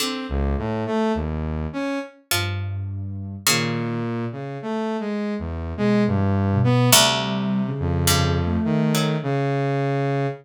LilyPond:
<<
  \new Staff \with { instrumentName = "Pizzicato Strings" } { \clef bass \time 3/4 \tempo 4 = 52 d4 r4 f4 | cis2. | d,4 g,8. fis4~ fis16 | }
  \new Staff \with { instrumentName = "Ocarina" } { \time 3/4 r2 g,4 | dis8 r4. \tuplet 3/2 { b,8 e8 b,8 } | \tuplet 3/2 { g4 cis4 a4 } r4 | }
  \new Staff \with { instrumentName = "Lead 2 (sawtooth)" } { \time 3/4 c'16 cis,16 a,16 a16 dis,8 cis'16 r4 r16 | ais,8. cis16 \tuplet 3/2 { a8 gis8 e,8 } gis16 g,8 b16 | c8. f,8. dis8 cis4 | }
>>